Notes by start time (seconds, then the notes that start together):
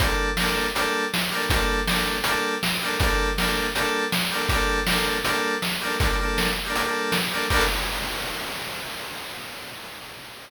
0.00 G3 A#3 D4, kick, closed hi-hat
0.06 A4
0.37 G3 A#3, snare
0.41 D4 A4
0.75 G3 A#3 D4, closed hi-hat
0.81 A4
1.14 snare
1.31 G3 A#3 D4
1.37 A4
1.50 G3 A#3, kick, closed hi-hat
1.54 D4 A4
1.87 G3 A#3 D4, snare
1.93 A4
2.24 G3 A#3, closed hi-hat
2.29 D4 A4
2.63 snare
2.81 G3 A#3 D4
2.87 A4
3.00 G3 A#3, kick, closed hi-hat
3.04 D4 A4
3.38 G3 A#3 D4, snare
3.43 A4
3.75 G3 A#3 D4, closed hi-hat
3.81 A4
4.12 snare
4.31 G3 A#3 D4
4.37 A4
4.49 G3 A#3, kick, closed hi-hat
4.54 D4 A4
4.87 G3 A#3, snare
4.91 D4 A4
5.25 G3 A#3, closed hi-hat
5.29 D4 A4
5.62 snare
5.81 G3 A#3 D4
5.87 A4
6.00 G3 A#3 D4, kick, closed hi-hat
6.06 G3 A4
6.11 A#3 D4 A4
6.19 G3 A#3 D4
6.25 A4
6.38 snare
6.66 G3 A#3 D4
6.71 G3 A4, closed hi-hat
6.77 A#3 D4 A4
6.84 G3 A#3 D4
6.90 A4
7.12 snare
7.31 G3 A#3 D4
7.37 A4
7.50 G3 A#3 D4, kick, crash
7.56 A4